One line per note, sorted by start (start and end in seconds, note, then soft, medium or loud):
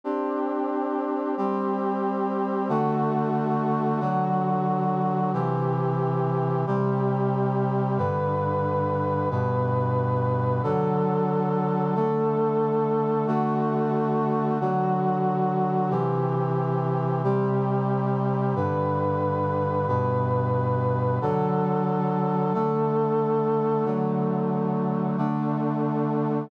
0.04 1.35 C4 medium
0.04 1.35 D4 medium
0.04 1.35 G4 medium
1.37 2.68 G3 medium
1.37 2.68 C4 medium
1.37 2.68 G4 medium
2.69 4.00 D3 medium
2.69 4.00 A3 loud
2.69 4.00 F#4 medium
4.00 5.31 D3 medium
4.00 5.31 F#3 medium
4.00 5.31 F#4 medium
5.33 6.64 C3 medium
5.33 6.64 E3 loud
5.33 6.64 G4 medium
6.67 7.98 C3 medium
6.67 7.98 G3 loud
6.67 7.98 G4 medium
7.98 9.29 G2 medium
7.98 9.29 D3 medium
7.98 9.29 B4 medium
9.31 10.62 G2 medium
9.31 10.62 B2 medium
9.31 10.62 B4 medium
10.63 11.94 D3 medium
10.63 11.94 F#3 medium
10.63 11.94 A4 medium
11.95 13.26 D3 medium
11.95 13.26 A3 medium
11.95 13.26 A4 medium
13.27 14.58 D3 medium
13.27 14.58 A3 loud
13.27 14.58 F#4 medium
14.60 15.91 D3 medium
14.60 15.91 F#3 medium
14.60 15.91 F#4 medium
15.90 17.22 C3 medium
15.90 17.22 E3 loud
15.90 17.22 G4 medium
17.24 18.55 C3 medium
17.24 18.55 G3 loud
17.24 18.55 G4 medium
18.56 19.87 G2 medium
18.56 19.87 D3 medium
18.56 19.87 B4 medium
19.88 21.19 G2 medium
19.88 21.19 B2 medium
19.88 21.19 B4 medium
21.21 22.52 D3 medium
21.21 22.52 F#3 medium
21.21 22.52 A4 medium
22.54 23.85 D3 medium
22.54 23.85 A3 medium
22.54 23.85 A4 medium
23.85 25.16 D3 medium
23.85 25.16 F#3 medium
23.85 25.16 A3 medium
25.17 26.49 D3 medium
25.17 26.49 A3 medium
25.17 26.49 D4 medium